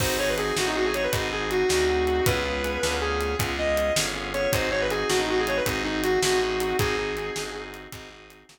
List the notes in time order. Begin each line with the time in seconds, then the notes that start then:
0.00 G#1 C4 D#4 F#4 G#4 C5, kick, crash
0.18 C4 D#4 F#4 G#4 C#5
0.29 B4
0.38 C4 D#4 F#4 G#4, closed hi-hat
0.56 A1 C4 D#4 F#4 G#4, snare
0.67 D#4
0.75 C4 D#4 F#4 G#4
0.85 G#4
0.94 C#5, closed hi-hat
1.03 B4
1.13 G#1 C4 D#4 F#4 G#4, kick, closed hi-hat
1.32 C4 D#4 F#4 G#4
1.51 F#4, closed hi-hat
1.69 D2 C4 D#4 F#4 G#4, snare
1.89 C4 D#4 F#4 G#4
2.07 C4 D#4 F#4 G#4, closed hi-hat
2.26 C#2 B3 C#4 F4 G#4 B4, kick, closed hi-hat
2.45 B3 C#4 F4 G#4
2.64 B3 C#4 F4 G#4, closed hi-hat
2.83 D2 B3 C#4 F4 G#4, snare
3.01 B3 C#4 F4 G#4
3.21 closed hi-hat
3.39 C#2 B3 C#4 F4 G#4, kick, closed hi-hat
3.58 B3 C#4 F4 G#4 D#5
3.77 closed hi-hat
3.96 G1 B3 C#4 F4 G#4, snare
4.15 B3 C#4 F4 G#4
4.34 B3 C#4 F4 G#4 C#5, closed hi-hat
4.53 G#1 C4 D#4 F#4 G#4 C5, kick, closed hi-hat
4.71 C4 D#4 F#4 G#4 C#5
4.81 B4
4.90 C4 D#4 F#4 G#4, closed hi-hat
5.09 A1 C4 D#4 F#4 G#4, snare
5.19 D#4
5.28 C4 D#4 F#4 G#4
5.39 G#4
5.47 C#5, closed hi-hat
5.57 B4
5.66 G#1 C4 D#4 F#4 G#4, kick, closed hi-hat
5.84 C4 D#4 F#4 G#4
6.04 F#4, closed hi-hat
6.22 A1 C4 D#4 F#4 G#4, snare
6.42 C4 D#4 F#4 G#4
6.60 C4 D#4 F#4 G#4, closed hi-hat
6.79 G#1 C4 D#4 F#4 G#4, kick, closed hi-hat
6.98 C4 D#4 F#4 G#4
7.17 C4 D#4 F#4 G#4, closed hi-hat
7.36 G1 C4 D#4 F#4 G#4, snare
7.55 C4 D#4 F#4 G#4
7.74 closed hi-hat
7.92 G#1 C4 D#4 F#4 G#4, kick, closed hi-hat
8.11 C4 D#4 F#4 G#4
8.30 closed hi-hat
8.49 A#1 C4 D#4 F#4 G#4, snare